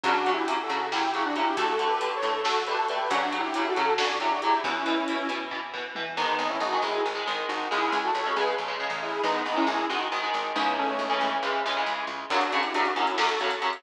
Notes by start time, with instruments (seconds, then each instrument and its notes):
0.03 electric bass (finger) F#2, overdriven guitar C#3 F#3, lead 2 (sawtooth) D4 F#4, kick, closed hi-hat
0.26 overdriven guitar C#3 F#3, closed hi-hat
0.33 lead 2 (sawtooth) E4 G4
0.47 overdriven guitar C#3 F#3, closed hi-hat
0.63 lead 2 (sawtooth) F#4 A4
0.69 electric bass (finger) C#3, overdriven guitar C#3 F#3, closed hi-hat
0.92 overdriven guitar C#3 F#3, lead 2 (sawtooth) E4 G4, snare
1.13 overdriven guitar C#3 F#3, lead 2 (sawtooth) E4 G4, closed hi-hat
1.25 lead 2 (sawtooth) D4 F#4
1.36 overdriven guitar C#3 F#3, lead 2 (sawtooth) E4 G4, closed hi-hat
1.57 electric bass (finger) D2, overdriven guitar D3 A3, lead 2 (sawtooth) F#4 A4, kick, closed hi-hat
1.79 overdriven guitar D3 A3, closed hi-hat
1.86 lead 2 (sawtooth) G4 B4
2.01 overdriven guitar D3 A3, closed hi-hat
2.16 lead 2 (sawtooth) A4 C#5
2.22 electric bass (finger) A2, overdriven guitar D3 A3, closed hi-hat
2.44 overdriven guitar D3 A3, lead 2 (sawtooth) F#4 A4, snare
2.67 overdriven guitar D3 A3, lead 2 (sawtooth) G4 B4, closed hi-hat
2.78 lead 2 (sawtooth) F#4 A4
2.88 overdriven guitar D3 A3, lead 2 (sawtooth) G4 B4, closed hi-hat
3.10 electric bass (finger) F#2, overdriven guitar C#3 F#3, lead 2 (sawtooth) D4 F#4, kick, closed hi-hat
3.32 overdriven guitar C#3 F#3, closed hi-hat
3.39 lead 2 (sawtooth) E4 G4
3.54 overdriven guitar C#3 F#3, closed hi-hat
3.68 lead 2 (sawtooth) F#4 A4
3.76 overdriven guitar C#3 F#3, electric bass (finger) C#3, closed hi-hat
3.98 overdriven guitar C#3 F#3, lead 2 (sawtooth) D4 F#4, snare
4.20 overdriven guitar C#3 F#3, lead 2 (sawtooth) E4 G4, closed hi-hat
4.30 lead 2 (sawtooth) D4 F#4
4.42 overdriven guitar C#3 F#3, lead 2 (sawtooth) E4 G4, closed hi-hat
4.64 electric bass (finger) E2, overdriven guitar B2 E3, lead 2 (sawtooth) C#4 E4, kick
4.86 overdriven guitar B2 E3, closed hi-hat
5.08 overdriven guitar B2 E3, closed hi-hat
5.29 electric bass (finger) B2, overdriven guitar B2 E3, closed hi-hat
5.51 overdriven guitar B2 E3, kick, floor tom
5.73 overdriven guitar B2 E3, mid tom
5.95 overdriven guitar B2 E3, high tom
6.17 electric bass (finger) G#1, overdriven guitar D#3 G#3, lead 2 (sawtooth) B3 D#4
6.39 electric bass (finger) G#1
6.49 lead 2 (sawtooth) C#4 E4
6.60 electric bass (finger) G#1, lead 2 (sawtooth) D#4 F#4
6.72 overdriven guitar D#3 G#3
6.82 electric bass (finger) G#1, overdriven guitar D#3 G#3, lead 2 (sawtooth) E4 G#4
7.05 electric bass (finger) G#1
7.15 overdriven guitar D#3 G#3
7.26 electric bass (finger) G#1, overdriven guitar D#3 G#3
7.48 electric bass (finger) G#1, lead 2 (sawtooth) D#4 F#4
7.71 electric bass (finger) C#2, overdriven guitar C#3 G#3, lead 2 (sawtooth) E4 G#4
7.92 electric bass (finger) C#2
8.04 lead 2 (sawtooth) F#4 A4
8.14 electric bass (finger) C#2, lead 2 (sawtooth) A4 C#5
8.26 overdriven guitar C#3 G#3
8.36 electric bass (finger) C#2, overdriven guitar C#3 G#3, lead 2 (sawtooth) G#4 B4
8.58 electric bass (finger) A#1
8.68 overdriven guitar C#3 G#3
8.80 overdriven guitar C#3 G#3
8.90 electric bass (finger) A1
9.02 lead 2 (sawtooth) E4 G#4
9.23 electric bass (finger) G#1, overdriven guitar D#3 G#3, lead 2 (sawtooth) B3 D#4
9.46 electric bass (finger) G#1
9.56 overdriven guitar D#3 G#3, lead 2 (sawtooth) C#4 E4
9.67 electric bass (finger) G#1, lead 2 (sawtooth) E4 G#4
9.89 electric bass (finger) G#1, overdriven guitar D#3 G#3, lead 2 (sawtooth) D#4 F#4
10.12 electric bass (finger) G#1, overdriven guitar D#3 G#3
10.23 overdriven guitar D#3 G#3
10.34 electric bass (finger) G#1
10.55 electric bass (finger) C#2, overdriven guitar C#3 E3 G#3, lead 2 (sawtooth) B3 D#4
10.78 lead 2 (sawtooth) A3 C#4
10.99 electric bass (finger) C#2
11.09 overdriven guitar C#3 E3 G#3
11.21 electric bass (finger) C#2
11.42 electric bass (finger) C#2, overdriven guitar C#3 E3 G#3
11.65 electric bass (finger) C#2, overdriven guitar C#3 E3 G#3
11.76 overdriven guitar C#3 E3 G#3
11.86 electric bass (finger) C#2
12.07 electric bass (finger) C#2
12.30 overdriven guitar F#2 C#3 F#3, lead 2 (sawtooth) D4 F#4, kick, crash
12.41 closed hi-hat
12.52 overdriven guitar F#2 C#3 F#3, closed hi-hat
12.63 lead 2 (sawtooth) E4 G4, closed hi-hat
12.74 overdriven guitar F#2 C#3 F#3, lead 2 (sawtooth) D4 F#4, closed hi-hat
12.85 closed hi-hat
12.96 overdriven guitar F#2 C#3 F#3, lead 2 (sawtooth) C#4 E4, closed hi-hat
13.07 closed hi-hat
13.18 overdriven guitar F#2 C#3 F#3, lead 2 (sawtooth) F#4 A4, snare
13.29 closed hi-hat
13.40 overdriven guitar F#2 C#3 F#3, closed hi-hat
13.51 closed hi-hat
13.61 overdriven guitar F#2 C#3 F#3, closed hi-hat
13.73 closed hi-hat